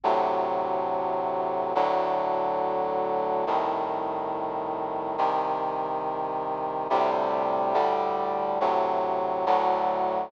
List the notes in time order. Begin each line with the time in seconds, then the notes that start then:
0.04 D2 A2 C3 F#3
1.75 D2 A2 D3 F#3
3.47 C2 A2 D#3
5.18 C2 C3 D#3
6.90 D2 A2 C3 G3
7.74 D2 A2 D3 G3
8.61 D2 A2 C3 F#3
9.46 D2 A2 D3 F#3